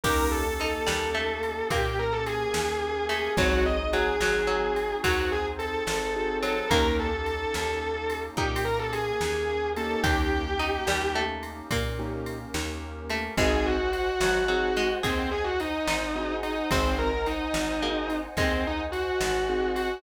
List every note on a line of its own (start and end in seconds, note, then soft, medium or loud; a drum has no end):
0.03 0.79 D#2 medium
0.03 0.43 A#3 medium
0.03 1.70 A#3 loud
0.03 0.43 C#4 medium
0.03 1.70 C#4 loud
0.03 0.43 D#4 loud
0.03 1.70 D#4 loud
0.03 0.43 G4 medium
0.03 0.57 G4 medium
0.03 1.70 G4 loud
0.03 0.27 A#4 medium
0.03 kick loud
0.03 crash loud
0.31 0.58 A4 medium
0.59 0.88 D#4 medium
0.59 1.66 A4 medium
0.59 ride medium
0.86 1.63 D#2 medium
0.86 1.11 G3 medium
0.86 snare loud
1.14 1.68 A3 medium
1.43 ride medium
1.70 2.45 A#2 medium
1.70 2.86 A#3 medium
1.70 3.37 A#3 medium
1.70 3.37 C#4 loud
1.70 1.97 G4 medium
1.70 3.37 G4 loud
1.70 3.37 A#4 medium
1.70 kick medium
1.70 ride medium
1.99 2.12 A#4 medium
2.13 2.26 A4 medium
2.26 3.05 G#4 medium
2.26 ride medium
2.54 3.29 D#2 medium
2.54 snare loud
3.09 3.33 A3 medium
3.09 3.33 G#4 medium
3.09 ride medium
3.37 4.12 G#1 medium
3.37 3.85 F#3 medium
3.37 3.76 C4 medium
3.37 5.02 C4 medium
3.37 3.76 D#4 loud
3.37 5.02 D#4 loud
3.37 3.76 F#4 medium
3.37 3.63 F#4 medium
3.37 5.04 F#4 medium
3.37 3.76 G#4 medium
3.37 5.02 G#4 medium
3.37 kick loud
3.37 ride loud
3.66 3.89 D#5 medium
3.93 4.16 F#3 medium
3.93 4.96 G#4 medium
3.93 ride medium
4.20 4.95 G#1 medium
4.20 4.47 F#3 medium
4.20 snare medium
4.47 5.00 F#3 medium
4.76 ride medium
5.03 5.80 D#2 medium
5.03 6.23 F#3 medium
5.03 6.68 C4 loud
5.03 6.68 D#4 loud
5.03 5.28 F#4 medium
5.03 6.68 G#4 loud
5.03 6.68 C5 loud
5.03 kick medium
5.03 ride loud
5.32 5.45 G#4 medium
5.59 6.35 A4 medium
5.59 ride medium
5.87 6.62 G#1 medium
5.87 snare loud
6.15 6.54 C4 medium
6.15 6.54 D#4 medium
6.15 6.54 F#4 medium
6.15 6.54 G#4 medium
6.42 6.67 F#3 medium
6.42 6.69 A4 medium
6.42 ride medium
6.70 7.46 D#2 medium
6.70 7.10 A#3 loud
6.70 8.36 A#3 medium
6.70 8.22 A#3 medium
6.70 7.10 C#4 loud
6.70 8.36 C#4 loud
6.70 7.10 D#4 medium
6.70 8.36 D#4 loud
6.70 7.10 G4 medium
6.70 8.36 G4 loud
6.70 6.93 A#4 loud
6.70 kick medium
6.70 ride medium
6.99 7.26 A4 medium
7.26 8.18 A4 medium
7.26 ride medium
7.54 8.30 D#2 medium
7.54 snare medium
8.10 ride medium
8.37 9.12 A#2 medium
8.37 10.04 A#3 loud
8.37 10.04 C#4 loud
8.37 9.81 D#4 medium
8.37 8.62 G4 medium
8.37 10.04 G4 loud
8.37 10.04 A#4 medium
8.37 kick medium
8.56 ride medium
8.64 8.78 A#4 medium
8.79 8.92 A4 medium
8.92 9.68 G#4 medium
8.92 ride medium
9.21 9.96 D#2 medium
9.21 snare medium
9.76 10.43 A#3 loud
9.76 10.43 C#4 loud
9.76 10.43 D#4 medium
9.76 10.43 G4 medium
9.76 10.02 A4 medium
9.76 ride medium
10.03 10.79 D#2 medium
10.03 11.70 A#3 medium
10.03 11.70 C#4 medium
10.03 11.70 D#4 loud
10.03 11.17 G4 loud
10.03 10.51 G4 medium
10.03 11.70 G4 loud
10.03 kick loud
10.03 ride medium
10.59 10.84 D#4 medium
10.59 ride medium
10.87 11.62 D#2 medium
10.87 11.15 G3 medium
10.87 snare loud
11.15 11.62 A3 medium
11.43 ride medium
11.70 12.45 A#2 medium
11.70 13.35 A#3 loud
11.70 13.03 A#3 medium
11.70 13.35 C#4 loud
11.70 13.35 G4 medium
11.70 13.35 A#4 medium
11.70 kick medium
11.70 ride loud
11.98 12.37 A#3 medium
11.98 12.37 C#4 medium
11.98 12.37 D#4 medium
11.98 12.37 G4 medium
12.26 ride medium
12.54 13.29 D#2 medium
12.54 snare loud
13.09 13.35 A3 medium
13.09 ride medium
13.37 14.12 G#1 medium
13.37 14.19 G#3 medium
13.37 13.76 C4 loud
13.37 13.76 D#4 loud
13.37 13.76 F#4 loud
13.37 13.76 G#4 loud
13.37 13.64 G#4 loud
13.37 16.67 C5 loud
13.37 16.67 D#5 loud
13.37 16.67 F#5 loud
13.37 16.67 G#5 medium
13.37 kick medium
13.37 ride medium
13.66 13.90 F#4 medium
13.92 14.92 F#4 medium
13.92 ride medium
14.20 14.95 G#1 medium
14.20 14.45 F#3 medium
14.20 snare loud
14.48 14.70 F#3 medium
14.48 14.87 C4 medium
14.48 14.87 D#4 medium
14.48 14.87 F#4 medium
14.48 14.87 G#4 medium
14.76 15.00 G#3 medium
14.76 ride medium
15.03 15.79 D#2 medium
15.03 15.30 C4 medium
15.03 15.70 G#4 medium
15.03 kick medium
15.03 ride medium
15.31 15.44 G#4 medium
15.44 15.57 F#4 medium
15.60 16.34 D#4 medium
15.60 ride medium
15.87 16.62 G#1 medium
15.87 16.66 D#4 medium
15.87 snare loud
16.15 16.54 C4 medium
16.15 16.54 D#4 medium
16.15 16.54 F#4 medium
16.15 16.54 G#4 medium
16.43 16.69 D#4 medium
16.43 ride medium
16.70 17.47 G#1 medium
16.70 16.94 C4 medium
16.70 17.10 C4 medium
16.70 17.67 C4 medium
16.70 17.10 D#4 medium
16.70 17.10 F#4 medium
16.70 17.10 G#4 loud
16.70 20.01 C5 loud
16.70 20.01 D#5 loud
16.70 20.01 F#5 loud
16.70 20.01 G#5 loud
16.70 kick loud
16.70 ride loud
16.98 17.25 A#4 medium
17.26 18.16 D#4 medium
17.26 ride medium
17.54 18.29 G#1 medium
17.54 snare loud
17.82 18.32 A#3 medium
17.82 18.21 C4 medium
17.82 18.21 D#4 medium
17.82 18.21 F#4 medium
17.82 18.21 G#4 medium
18.10 ride medium
18.37 19.12 D#2 medium
18.37 19.44 G#3 medium
18.37 18.62 C4 medium
18.37 kick medium
18.37 ride medium
18.67 18.80 D#4 medium
18.92 19.71 F#4 medium
18.92 ride medium
19.20 19.95 G#1 medium
19.20 snare loud
19.48 19.87 C4 medium
19.48 19.87 D#4 medium
19.48 19.87 F#4 medium
19.48 19.87 G#4 medium
19.75 19.98 F#4 medium
19.75 ride medium